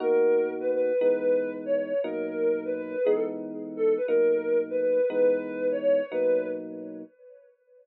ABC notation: X:1
M:5/8
L:1/16
Q:1/4=147
K:Bmix
V:1 name="Ocarina"
^A6 B B3 | B6 c c3 | ^A6 B B3 | G A z5 A2 B |
^A6 B B3 | B6 c c3 | B4 z6 |]
V:2 name="Electric Piano 1"
[B,,^A,DF]10 | [E,G,B,D]10 | [B,,F,^A,D]10 | [E,G,B,D]10 |
[B,,F,^A,D]10 | [E,G,B,D]10 | [B,,F,^A,D]10 |]